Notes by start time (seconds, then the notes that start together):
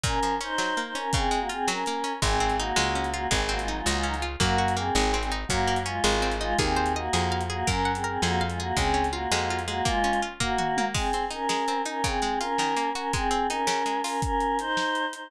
0.03 A#2 C#4 A#4, kick, closed hi-hat
0.23 F3, closed hi-hat
0.41 C#4 D#4 C5, closed hi-hat
0.58 F#3, snare
0.77 A#3, closed hi-hat
0.87 D#4 C5
0.95 C#4 A#4, closed hi-hat
1.13 C#3 C4 G#4, kick, closed hi-hat
1.31 G#3, closed hi-hat
1.40 A#3 F#4
1.49 C4 F4 G#4, closed hi-hat
1.68 F#3 C#4 A#4, snare
1.86 A#3, closed hi-hat
2.04 C#4, closed hi-hat
2.22 G#1 G#3 C4 G#4, kick, closed hi-hat
2.40 C4
2.50 closed hi-hat
2.58 A#3 D#4 F#4
2.76 C#2 G#3, snare
2.95 C#4
3.04 closed hi-hat
3.12 A#3 F4 F#4
3.31 G#1 G#3 C4 G#4, kick, closed hi-hat
3.41 C4 G#4
3.49 A#3 C4 F#4
3.59 G#3 F4, closed hi-hat
3.68 F#3 D#4
3.77 G#3 F4
3.86 C#2 G#3 A#3 F#4, snare
3.97 G#3 F4
4.03 F#3 C#4 D#4
4.14 G#3 F4, closed hi-hat
4.22 F4
4.40 F#2 A#3 F#4, kick, closed hi-hat
4.58 F#4
4.68 closed hi-hat
4.76 A#3 C4 G#4
4.95 G#1 G#3, snare
5.14 C4
5.22 C4 G#4, closed hi-hat
5.32 D#4
5.48 F#2 F#3 A#3 F#4, kick, closed hi-hat
5.67 A#3
5.76 closed hi-hat
5.86 G#3 C#4 F4
6.04 G#1 G#3, snare
6.22 C4
6.32 closed hi-hat
6.40 G#3 D#4 F4
6.59 D#2 C4 G#4, kick, closed hi-hat
6.76 C5
6.86 closed hi-hat
6.96 A#3 F#4 D#5
7.13 F2 G#4, snare
7.32 F5
7.41 closed hi-hat
7.50 A#3 F#4 G#4
7.67 F#2 C#4 A#4, kick, closed hi-hat
7.85 F#5
7.95 C4 G#4, closed hi-hat
8.04 C4 G#4 A#4
8.22 F2 A#3 F#4 G#4, snare
8.41 F5
8.50 G#3 F4, closed hi-hat
8.59 A#3 F#4 G#4
8.76 C#2 G#3 C4 G#4, kick, closed hi-hat
8.94 C#4
9.04 closed hi-hat
9.11 A#3 F4 F#4
9.31 F2 G#3, snare
9.50 F4
9.59 closed hi-hat
9.67 G#3 A#3 F#4
9.85 G#3 A#3 F4, kick, closed hi-hat
10.04 C#4
10.13 closed hi-hat
10.22 F4
10.40 A#3 F#4, kick, floor tom
10.58 F#4, mid tom
10.77 A#3, high tom
10.94 G#3 C4 G#4, kick, crash
11.13 C4, closed hi-hat
11.31 C#4 D#4 A#4, closed hi-hat
11.49 G#3, snare
11.68 C4, closed hi-hat
11.86 C#4 D#4 A#4, closed hi-hat
12.04 C#3 C4 G#4, kick, closed hi-hat
12.22 G#3, closed hi-hat
12.40 C#4 F4 A#4, closed hi-hat
12.58 D#3, snare
12.77 A#3, closed hi-hat
12.95 C#4 F#4 A#4, closed hi-hat
13.13 G#3 C4 G#4, kick, closed hi-hat
13.31 C4, closed hi-hat
13.48 C#4 D#4 A#4, closed hi-hat
13.67 C#3, snare
13.86 G#3, closed hi-hat
14.03 C#4 F4 A#4, open hi-hat
14.22 C#4 A#4, kick, closed hi-hat
14.41 closed hi-hat
14.59 D#4 C5, closed hi-hat
14.77 snare
14.95 closed hi-hat
15.13 D#4 C5, closed hi-hat